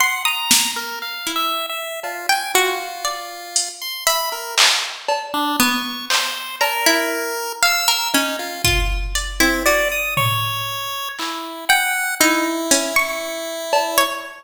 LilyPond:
<<
  \new Staff \with { instrumentName = "Pizzicato Strings" } { \time 2/4 \tempo 4 = 59 c'''16 dis'''8 r8 e'16 r8 | r16 g''16 fis'8 d''16 r8. | e''8 r4 b8 | r8 ais''16 e'8 r16 f''16 ais'16 |
cis'16 r16 f'8 d''16 e'16 fis'8 | r4. g''16 r16 | dis'16 r16 cis'16 cis'''4 cis''16 | }
  \new Staff \with { instrumentName = "Lead 1 (square)" } { \time 2/4 fis''16 ais''8 ais'16 \tuplet 3/2 { f''8 e''8 e''8 } | f'16 gis''16 f'4~ f'16 c'''16 | b''16 ais'16 r8. d'16 cis'''8 | c''8 ais'4 e'''8 |
dis'16 f'16 r8. c'16 d''16 dis'''16 | cis''4 e'8 fis''8 | e'2 | }
  \new DrumStaff \with { instrumentName = "Drums" } \drummode { \time 2/4 r8 sn8 r4 | cb4 r8 hh8 | hh8 hc8 cb4 | hc8 cb8 r4 |
r8 bd8 hh4 | tomfh4 hc4 | r8 hh8 r8 cb8 | }
>>